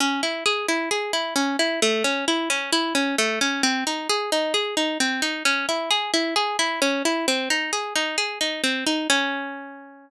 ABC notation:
X:1
M:4/4
L:1/8
Q:1/4=132
K:C#m
V:1 name="Pizzicato Strings"
C E G E G E C E | A, C E C E C A, C | ^B, D G D G D B, D | C E G E G E C E |
^B, D G D G D B, D | C8 |]